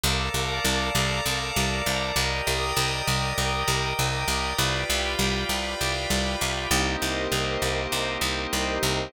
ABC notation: X:1
M:7/8
L:1/8
Q:1/4=99
K:Cdor
V:1 name="Drawbar Organ"
[ABdf]7 | [M:4/4] [GBde]8 | [M:7/8] [FG=Bd]7 | [M:4/4] [B,CEG]8 |]
V:2 name="Pad 5 (bowed)"
[fabd']7 | [M:4/4] [gbd'e']8 | [M:7/8] [fg=bd']7 | [M:4/4] [GBce]8 |]
V:3 name="Electric Bass (finger)" clef=bass
C,, C,, C,, C,, C,, C,, C,, | [M:4/4] C,, C,, C,, C,, C,, C,, C,, C,, | [M:7/8] C,, C,, C,, C,, C,, C,, C,, | [M:4/4] C,, C,, C,, C,, C,, C,, C,, C,, |]